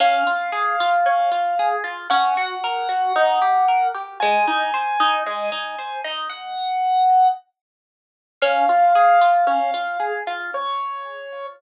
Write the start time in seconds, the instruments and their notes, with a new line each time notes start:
0.00 orchestral harp C#4, acoustic grand piano F5
0.27 orchestral harp F4
0.52 orchestral harp G#4
0.80 orchestral harp F4
1.06 orchestral harp C#4
1.32 orchestral harp F4
1.59 orchestral harp G#4
1.84 orchestral harp F4
2.10 orchestral harp C#4, acoustic grand piano F#5
2.37 orchestral harp F#4
2.64 orchestral harp A#4
2.89 orchestral harp F#4
3.16 orchestral harp D#4
3.42 orchestral harp G4
3.68 orchestral harp A#4
3.94 orchestral harp G4
4.20 orchestral harp G#3, acoustic grand piano G#5
4.47 orchestral harp D#4
4.74 orchestral harp C5
5.00 orchestral harp D#4
5.26 orchestral harp G#3
5.52 orchestral harp D#4
5.79 orchestral harp C5
6.04 orchestral harp D#4
6.29 acoustic grand piano F#5
8.42 orchestral harp C#4, acoustic grand piano F5
8.69 orchestral harp F4
8.95 orchestral harp G#4
9.21 orchestral harp F4
9.47 orchestral harp C#4
9.74 orchestral harp F4
10.00 orchestral harp G#4
10.27 orchestral harp F4
10.54 acoustic grand piano C#5